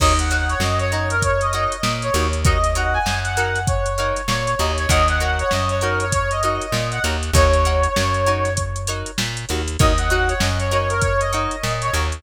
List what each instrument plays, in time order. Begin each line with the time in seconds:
0.00 electric bass (finger) D#2, acoustic guitar (steel) D#4 F#4 A#4 C#5, brass section D#5, kick, crash
0.19 brass section F#5, snare, closed hi-hat
0.30 acoustic guitar (steel) D#4 F#4 A#4 C#5, brass section F#5, closed hi-hat
0.49 brass section C#5, closed hi-hat
0.60 electric bass (finger) F#2, brass section D#5, snare
0.79 brass section C#5, closed hi-hat
0.92 acoustic guitar (steel) D#4 F#4 A#4 C#5, brass section C#5, closed hi-hat
1.10 brass section A#4, closed hi-hat
1.22 brass section C#5, kick, closed hi-hat
1.41 brass section D#5, snare, closed hi-hat
1.53 acoustic guitar (steel) D#4 F#4 A#4 C#5, brass section D#5, snare, closed hi-hat
1.72 closed hi-hat
1.83 electric bass (finger) A#2, snare
2.02 brass section C#5, closed hi-hat
2.14 electric bass (finger) D#2, acoustic guitar (steel) D#4 F#4 A#4 C#5, closed hi-hat
2.33 closed hi-hat
2.45 acoustic guitar (steel) D#4 F#4 A#4 C#5, brass section D#5, kick, closed hi-hat
2.64 snare, closed hi-hat
2.75 acoustic guitar (steel) D#4 F#4 A#4 C#5, brass section F#5, closed hi-hat
2.94 brass section G#5, snare
3.06 electric bass (finger) F#2, snare
3.24 brass section F#5, closed hi-hat
3.37 acoustic guitar (steel) D#4 F#4 A#4 C#5, closed hi-hat
3.55 snare, closed hi-hat
3.67 brass section C#5, kick, closed hi-hat
3.86 closed hi-hat
3.98 acoustic guitar (steel) D#4 F#4 A#4 C#5, snare, closed hi-hat
4.16 snare, closed hi-hat
4.28 electric bass (finger) A#2, brass section C#5, snare
4.47 closed hi-hat
4.59 electric bass (finger) D#2, acoustic guitar (steel) D#4 F#4 A#4 C#5, brass section D#5, closed hi-hat
4.78 brass section C#5, closed hi-hat
4.89 electric bass (finger) D#2, acoustic guitar (steel) D#4 F#4 A#4 C#5, brass section D#5, kick, closed hi-hat
5.08 brass section F#5, closed hi-hat
5.20 acoustic guitar (steel) D#4 F#4 A#4 C#5, brass section F#5, closed hi-hat
5.39 brass section C#5, closed hi-hat
5.51 electric bass (finger) F#2, brass section D#5, snare
5.69 brass section C#5, closed hi-hat
5.81 acoustic guitar (steel) D#4 F#4 A#4 C#5, brass section A#4, closed hi-hat
6.00 brass section C#5, closed hi-hat
6.12 brass section C#5, kick, closed hi-hat
6.31 brass section D#5, closed hi-hat
6.43 acoustic guitar (steel) D#4 F#4 A#4 C#5, brass section D#5, closed hi-hat
6.61 closed hi-hat
6.72 electric bass (finger) A#2, snare
6.92 brass section F#5, closed hi-hat
7.04 electric bass (finger) D#2, acoustic guitar (steel) D#4 F#4 A#4 C#5, closed hi-hat
7.23 closed hi-hat
7.33 electric bass (finger) D#2, acoustic guitar (steel) D#4 F#4 A#4 C#5, brass section C#5, kick, closed hi-hat
7.53 closed hi-hat
7.65 acoustic guitar (steel) D#4 F#4 A#4 C#5, closed hi-hat
7.83 closed hi-hat
7.96 electric bass (finger) F#2, snare
8.14 closed hi-hat
8.26 acoustic guitar (steel) D#4 F#4 A#4 C#5, closed hi-hat
8.45 snare, closed hi-hat
8.57 kick, closed hi-hat
8.76 closed hi-hat
8.87 acoustic guitar (steel) D#4 F#4 A#4 C#5, closed hi-hat
9.06 closed hi-hat
9.18 electric bass (finger) A#2, snare
9.37 closed hi-hat
9.49 electric bass (finger) D#2, acoustic guitar (steel) D#4 F#4 A#4 C#5, closed hi-hat
9.68 closed hi-hat
9.79 electric bass (finger) D#2, acoustic guitar (steel) D#4 F#4 A#4 C#5, brass section D#5, kick, closed hi-hat
9.98 brass section F#5, closed hi-hat
10.10 acoustic guitar (steel) D#4 F#4 A#4 C#5, brass section F#5, closed hi-hat
10.28 brass section C#5, closed hi-hat
10.40 electric bass (finger) F#2, brass section D#5, snare
10.59 brass section C#5, snare, closed hi-hat
10.71 acoustic guitar (steel) D#4 F#4 A#4 C#5, brass section C#5, closed hi-hat
10.90 brass section A#4, closed hi-hat
11.02 brass section C#5, kick, closed hi-hat
11.20 brass section D#5, closed hi-hat
11.33 acoustic guitar (steel) D#4 F#4 A#4 C#5, brass section D#5, closed hi-hat
11.51 closed hi-hat
11.64 electric bass (finger) A#2, snare
11.82 brass section C#5, closed hi-hat
11.93 electric bass (finger) D#2, acoustic guitar (steel) D#4 F#4 A#4 C#5, closed hi-hat
12.12 closed hi-hat